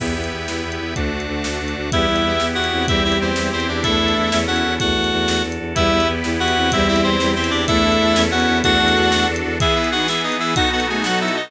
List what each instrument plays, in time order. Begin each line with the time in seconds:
0.00 violin E2, accordion B3 E4 G4, drawbar organ B4 E5 G5, kick, crash
0.16 violin E2
0.24 closed hi-hat
0.32 violin E2
0.48 violin E2, snare
0.64 violin E2
0.72 closed hi-hat
0.80 violin E2
0.96 violin D2, accordion A3 D4 F#4, drawbar organ A4 D5 F#5, kick, closed hi-hat
1.12 violin D2
1.20 closed hi-hat
1.28 violin D2
1.44 violin D2, snare
1.60 violin D2
1.68 closed hi-hat
1.76 violin D2
1.92 violin E2 G3, accordion B3 E4 G4, drawbar organ B3 E4 G4, clarinet E4 E5, kick, closed hi-hat
2.08 violin E2
2.16 closed hi-hat
2.24 violin E2
2.40 violin E2 E4, snare
2.55 violin E2, clarinet F#4 F#5
2.64 closed hi-hat
2.72 violin E2 C4
2.88 violin E2 G3, drawbar organ C4 E4 G4, accordion C4 E4 G4, clarinet E4 E5, kick, closed hi-hat
3.04 violin E2, clarinet E4 E5
3.12 closed hi-hat
3.20 violin E2, clarinet C4 C5
3.36 violin E2 G3, snare
3.52 violin E2, clarinet C4 C5
3.60 closed hi-hat
3.68 violin E2, clarinet D4 D5
3.82 violin E2 A3, accordion D4 E4 A4, drawbar organ D4 E4 A4, clarinet E4 E5, kick, closed hi-hat
4.00 violin E2
4.08 closed hi-hat
4.16 violin E2
4.32 violin E2, accordion C#4 E4 A4, drawbar organ C#4 E4 A4, snare
4.47 violin E2 B3, clarinet F#4 F#5
4.56 closed hi-hat
4.64 violin E2
4.80 violin E2 A3, drawbar organ D4 F#4 A4, clarinet F#4 F#5, kick, closed hi-hat
4.96 violin E2
5.04 closed hi-hat
5.12 violin E2
5.28 violin E2, snare
5.44 violin E2
5.52 closed hi-hat
5.60 violin E2
5.75 violin E2 G3, accordion B3 E4 G4, drawbar organ E4 G4 B4, clarinet E4 E5, kick, closed hi-hat
5.92 violin E2
6.00 closed hi-hat
6.08 violin E2
6.24 violin E2 E4, snare
6.40 violin E2, clarinet F#4 F#5
6.48 closed hi-hat
6.56 violin E2 C4
6.72 violin E2 G3, accordion C4 E4 G4, drawbar organ E4 G4 C5, clarinet E4 E5, kick, closed hi-hat
6.88 violin E2, clarinet E4 E5
6.96 closed hi-hat
7.04 violin E2, clarinet C4 C5
7.20 violin E2 G3, snare
7.36 violin E2, clarinet C4 C5
7.44 closed hi-hat
7.50 violin E2, clarinet D4 D5
7.68 violin E2 A3, drawbar organ D4 E4 A4, accordion D4 E4 A4, clarinet E4 E5, kick, closed hi-hat
7.84 violin E2
7.92 closed hi-hat
8.00 violin E2
8.15 violin E2, accordion C#4 E4 A4, drawbar organ C#4 E4 A4, snare
8.31 violin E2 B3, clarinet F#4 F#5
8.40 closed hi-hat
8.48 violin E2
8.64 violin E2 A3, accordion D4 F#4 A4, drawbar organ D4 F#4 A4, clarinet F#4 F#5, kick, closed hi-hat
8.80 violin E2
8.88 closed hi-hat
8.96 violin E2
9.12 violin E2, snare
9.28 violin E2
9.36 closed hi-hat
9.44 violin E2
9.60 drawbar organ E3 B3 G#4, accordion E3 B3 G#4, clarinet E4 E5, violin G#4, kick, closed hi-hat
9.76 clarinet E4 E5, violin E4
9.84 closed hi-hat
9.92 violin D#4, clarinet F#4 F#5
10.08 violin B3, clarinet E4 E5, snare
10.24 clarinet D#4 D#5
10.32 closed hi-hat
10.40 clarinet E4 E5
10.55 drawbar organ B2 F#3 D#4 A4, accordion B3 D#4 F#4 A4, violin D#4, clarinet F#4 F#5, kick, closed hi-hat
10.72 violin B3, clarinet F#4 F#5
10.80 closed hi-hat
10.89 violin A3, clarinet G#4 G#5
11.04 violin F#3, clarinet F#4 F#5, snare
11.21 clarinet E4 E5
11.28 closed hi-hat
11.36 clarinet D#4 D#5